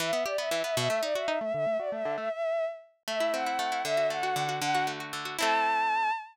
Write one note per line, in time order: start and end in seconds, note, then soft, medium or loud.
0.00 0.12 E3 loud
0.00 0.23 E5 medium
0.13 0.24 B3 medium
0.26 0.37 G4 medium
0.26 0.37 D5 medium
0.38 0.50 B3 medium
0.38 0.61 E5 medium
0.51 0.63 E3 medium
0.64 0.76 B3 medium
0.64 0.76 E5 medium
0.76 0.89 B2 loud
0.76 1.01 E5 medium
0.90 1.01 A3 medium
1.03 1.14 D#4 medium
1.03 1.15 D5 medium
1.15 1.27 F#4 medium
1.15 1.38 E5 medium
1.28 1.39 D#4 loud
1.41 1.53 A3 medium
1.41 1.52 E5 medium
1.54 1.66 D3 loud
1.54 1.77 E5 medium
1.66 1.78 A3 medium
1.79 1.91 F#4 medium
1.79 1.90 D5 medium
1.92 2.04 A3 medium
1.92 2.14 E5 medium
2.05 2.17 D3 loud
2.18 2.29 A3 medium
2.18 2.31 E5 medium
2.31 2.65 E5 medium
3.07 3.58 A3 medium
3.07 3.32 E5 medium
3.20 3.46 E4 medium
3.33 3.82 C4 medium
3.33 3.81 F#5 medium
3.46 3.71 E4 medium
3.59 3.83 A3 medium
3.72 3.84 E4 medium
3.85 4.35 D3 medium
3.85 4.07 E5 loud
3.97 4.23 F#4 medium
4.10 4.59 A3 medium
4.10 4.55 F#5 medium
4.23 4.48 F#4 medium
4.36 4.60 D3 medium
4.49 4.61 F#4 medium
4.62 5.12 D3 loud
4.62 4.83 F#5 medium
4.75 5.00 F#4 medium
4.87 5.36 A3 medium
5.00 5.25 F#4 medium
5.13 5.37 D3 medium
5.25 5.37 F#4 medium
5.39 6.11 A3 loud
5.39 6.11 C4 medium
5.39 6.11 E4 loud
5.39 6.11 A5 loud